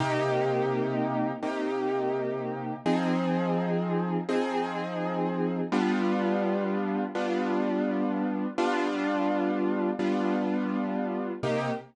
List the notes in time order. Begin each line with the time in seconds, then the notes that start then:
0.00 C3 A#3 D#4 G4
1.42 C3 A#3 D#4 G4
2.86 F3 C4 D#4 G#4
4.29 F3 C4 D#4 G#4
5.72 G3 B3 D4 F4
7.15 G3 B3 D4 F4
8.58 G3 B3 D4 F4
9.99 G3 B3 D4 F4
11.43 C3 A#3 D#4 G4